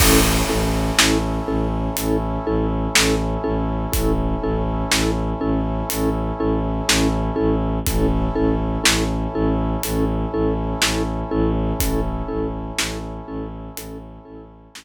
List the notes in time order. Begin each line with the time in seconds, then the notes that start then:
0.00 A1 C#4 E4 A4, kick, crash
0.49 A1 C#4 E4 A4
0.98 A1 C#4 E4 A4, snare
1.48 A1 C#4 E4 A4
1.97 A1 C#4 E4 A4, closed hi-hat
2.46 A1 C#4 E4 A4
2.95 A1 C#4 E4 A4, snare
3.44 A1 C#4 E4 A4
3.92 A1 C#4 E4 A4, kick, closed hi-hat
4.43 A1 C#4 E4 A4
4.91 A1 C#4 E4 A4, snare
5.41 A1 C#4 E4 A4
5.90 A1 C#4 E4 A4, closed hi-hat
6.40 A1 C#4 E4 A4
6.88 A1 C#4 E4 A4, snare
7.36 A1 C#4 E4 A4
7.86 A1 C#4 E4 A4, kick, closed hi-hat
8.35 A1 C#4 E4 A4
8.84 A1 C#4 E4 A4, snare
9.34 A1 C#4 E4 A4
9.83 A1 C#4 E4 A4, closed hi-hat
10.33 A1 C#4 E4 A4
10.82 A1 C#4 E4 A4, snare
11.31 A1 C#4 E4 A4
11.80 A1 C#4 E4 A4, kick, closed hi-hat
12.28 A1 C#4 E4 A4
12.78 A1 C#4 E4 A4, snare
13.28 A1 C#4 E4 A4
13.77 A1 C#4 E4 A4, closed hi-hat
14.25 A1 C#4 E4 A4
14.75 A1 C#4 E4 A4, snare